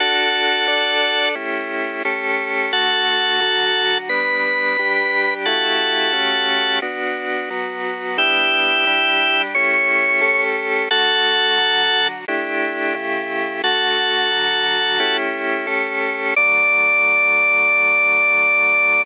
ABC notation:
X:1
M:4/4
L:1/8
Q:1/4=88
K:D
V:1 name="Drawbar Organ"
[FA]4 z4 | [FA]4 B4 | [FA]4 z4 | [EG]4 c3 z |
[FA]4 z4 | [FA]5 z3 | d8 |]
V:2 name="Drawbar Organ"
[DFA]2 [DAd]2 [A,CEG]2 [A,CGA]2 | [D,A,F]2 [D,F,F]2 [G,B,D]2 [G,DG]2 | [C,A,EG]2 [C,A,CG]2 [B,DF]2 [F,B,F]2 | [G,B,D]2 [G,DG]2 [A,CEG]2 [A,CGA]2 |
[D,A,F]2 [D,F,F]2 [A,DEG]2 [C,A,EG]2 | [D,A,F]2 [D,F,F]2 [A,CEG]2 [A,CGA]2 | [D,F,A,]8 |]